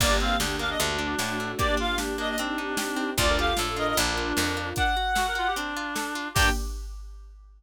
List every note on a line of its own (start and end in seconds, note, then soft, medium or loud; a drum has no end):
0.00 0.36 G1 loud
0.00 0.78 A#3 medium
0.00 0.19 A#3 loud
0.00 0.10 A#3 medium
0.00 0.78 D4 medium
0.00 0.78 G4 medium
0.00 0.16 D5 medium
0.00 kick loud
0.00 crash medium
0.10 0.19 D4 medium
0.20 0.37 C4 medium
0.20 0.38 D4 medium
0.20 0.38 F5 medium
0.40 0.76 D2 medium
0.40 0.56 D4 medium
0.40 0.58 G4 medium
0.40 snare loud
0.59 0.77 A#3 medium
0.59 0.77 D4 medium
0.59 0.69 F5 medium
0.70 0.79 D#5 medium
0.80 1.15 D2 loud
0.80 0.98 A3 loud
0.80 1.59 A3 medium
0.80 1.51 D4 medium
0.80 1.58 D4 medium
0.80 1.59 F#4 medium
0.80 closed hi-hat medium
0.99 1.16 D4 medium
1.19 1.55 A2 medium
1.19 1.38 F#4 medium
1.19 snare medium
1.40 1.58 A3 medium
1.58 2.37 A#3 medium
1.58 1.77 A#3 loud
1.58 2.37 D4 medium
1.58 2.37 G4 medium
1.58 1.68 G4 medium
1.58 1.75 D5 medium
1.58 kick medium
1.58 closed hi-hat medium
1.68 1.77 D4 medium
1.77 1.95 D4 medium
1.77 1.98 F4 medium
1.77 1.98 F5 medium
1.98 2.17 D4 medium
1.98 2.16 G4 medium
1.98 snare medium
2.18 2.36 A#3 medium
2.18 2.36 D4 medium
2.18 2.29 D#5 medium
2.29 2.39 D#5 medium
2.38 3.18 C4 medium
2.38 2.57 C4 loud
2.38 3.11 D4 medium
2.38 3.18 D#4 medium
2.38 3.18 G4 medium
2.38 closed hi-hat loud
2.58 2.76 D#4 medium
2.77 2.96 G4 medium
2.77 snare loud
2.96 3.14 C4 medium
3.17 3.53 D2 loud
3.17 3.96 D4 medium
3.17 3.35 D4 medium
3.17 3.96 F4 medium
3.17 3.28 F4 medium
3.17 3.96 A4 medium
3.17 3.37 D5 medium
3.17 kick medium
3.17 closed hi-hat medium
3.29 3.38 A#4 medium
3.38 3.57 F4 medium
3.38 3.54 G4 medium
3.38 3.57 F5 medium
3.57 3.94 A2 medium
3.57 3.75 A4 medium
3.57 3.77 A4 medium
3.57 snare medium
3.76 3.94 F4 medium
3.76 3.97 A#4 medium
3.76 3.87 D#5 medium
3.88 3.98 D#5 medium
3.97 4.33 A#1 loud
3.97 4.69 D4 medium
3.97 4.77 D4 medium
3.97 4.16 D4 medium
3.97 4.77 F4 medium
3.97 4.77 A#4 medium
3.97 closed hi-hat medium
4.17 4.35 F4 medium
4.37 4.73 F2 medium
4.37 4.55 A#4 medium
4.37 snare loud
4.57 4.75 F4 medium
4.76 4.95 D4 loud
4.76 5.53 F#5 medium
4.76 kick medium
4.76 closed hi-hat medium
4.97 5.14 F#4 medium
5.15 5.26 F#4 medium
5.15 5.33 A4 medium
5.15 snare loud
5.28 5.37 A#4 medium
5.35 5.47 F4 medium
5.35 5.53 F#4 medium
5.47 5.57 G4 medium
5.56 5.74 C4 loud
5.56 6.28 D4 medium
5.56 closed hi-hat medium
5.77 5.94 F4 loud
5.96 6.13 A4 medium
5.96 snare medium
6.15 6.33 F4 medium
6.34 6.50 G2 medium
6.34 6.49 A#3 loud
6.34 6.50 A#3 loud
6.34 6.49 D4 loud
6.34 6.48 G4 loud
6.34 6.49 G4 loud
6.34 6.49 G5 loud
6.34 kick loud
6.34 crash loud
6.39 6.50 D4 loud
6.39 6.50 G4 loud